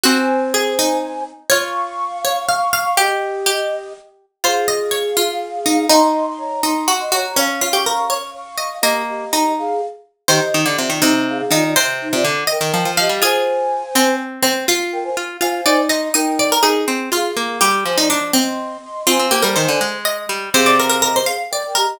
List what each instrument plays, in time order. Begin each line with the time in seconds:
0.03 pizzicato strings C4, harpsichord F#4, flute C5 G#5
0.54 harpsichord G#4
0.79 harpsichord D#4
1.50 pizzicato strings F4, harpsichord C#5, flute F5 C#6
2.25 harpsichord C#5
2.48 harpsichord F5
2.73 harpsichord F5
2.97 harpsichord G4, pizzicato strings G4, flute G4 D#5
3.46 harpsichord G4
4.44 pizzicato strings F4, flute G#4 F5, harpsichord C5
4.68 harpsichord D#5
4.91 harpsichord C#5
5.17 harpsichord F4
5.66 harpsichord D#4
5.89 harpsichord D#4, pizzicato strings D#4, flute D#5 C6
6.27 flute D#5 C6
6.38 flute C#5 A#5
6.63 harpsichord D#4, flute D#5 C6
6.88 harpsichord F#4
6.99 flute D#5 C6
7.12 harpsichord F#4, flute C#5 A#5
7.36 harpsichord C#4, pizzicato strings C#4, flute F5 C#6
7.61 harpsichord F4
7.72 harpsichord G4, flute F5 C#6
7.84 harpsichord A#4, flute F5 C#6
8.10 harpsichord C#5, flute F5 C#6
8.34 flute F5 C#6
8.58 harpsichord D#5
8.82 pizzicato strings A#3, flute G4 D#5, harpsichord D#5
9.08 flute G4 D#5
9.33 harpsichord D#4
9.58 flute G#4 F5
10.28 pizzicato strings D#3, flute G4 D#5, harpsichord C5
10.54 pizzicato strings D#3
10.66 pizzicato strings D3, flute G4 D#5
10.77 pizzicato strings C3, flute F4 D5
10.90 pizzicato strings D#3
11.02 pizzicato strings C3, harpsichord D#4, flute G4 D#5
11.28 flute G#4 F5
11.38 flute G#4 F5
11.51 pizzicato strings D#3, harpsichord D#4, flute F4 D5
11.64 flute F4 D5
11.76 pizzicato strings C3, harpsichord C5
12.01 flute D#4 C5
12.13 pizzicato strings C3, flute F4 D5
12.24 pizzicato strings D3
12.47 flute A#4 G5, harpsichord D#5
12.61 pizzicato strings D#3
12.74 pizzicato strings F3
12.85 pizzicato strings F3
12.97 pizzicato strings F3, flute G4 D#5, harpsichord F5
13.09 pizzicato strings G3
13.22 pizzicato strings F4, harpsichord G#4, flute C5 G#5
13.95 pizzicato strings C4, harpsichord C4
14.42 harpsichord C4
14.68 pizzicato strings F4, harpsichord F4
14.92 flute A#4 G5
15.04 flute C5 G#5
15.17 pizzicato strings F4
15.40 pizzicato strings F4, flute C5 G#5, harpsichord F5
15.66 pizzicato strings D#4, harpsichord D5
15.89 pizzicato strings D#4, harpsichord D#5, flute D#5 C6
16.14 pizzicato strings D#4, flute A#4 G5, harpsichord D#5
16.39 harpsichord D5
16.52 harpsichord A#4
16.63 pizzicato strings D#4, harpsichord G#4
16.88 pizzicato strings C4
17.12 pizzicato strings F4, harpsichord F4, flute G#4 F5
17.36 pizzicato strings A#3
17.61 pizzicato strings G3, harpsichord G4
17.85 pizzicato strings F3, flute C5 G#5
17.96 harpsichord D#4, flute D5 A#5
18.10 harpsichord D4
18.33 harpsichord C4, flute D#5 C6
18.83 flute D#5 C6
19.07 pizzicato strings C4, harpsichord F4, flute C5 G#5
19.19 pizzicato strings C4
19.31 pizzicato strings A#3, harpsichord G4
19.42 pizzicato strings G3, harpsichord A#4
19.56 pizzicato strings D#3, harpsichord C5
19.68 pizzicato strings D3
19.81 pizzicato strings G#3
20.05 harpsichord D#5
20.29 pizzicato strings G3
20.53 pizzicato strings C3, flute G#4 F5, harpsichord C5
20.66 harpsichord D5
20.79 harpsichord A#4
20.89 flute G#4 F5, harpsichord A#4
21.02 flute G4 D#5, harpsichord A#4
21.16 harpsichord C5
21.26 flute G#4 F5, harpsichord F5
21.51 flute A#4 G5, harpsichord D5
21.65 flute A#4 G5
21.75 flute G4 D#5, harpsichord A#4
21.87 flute G4 D#5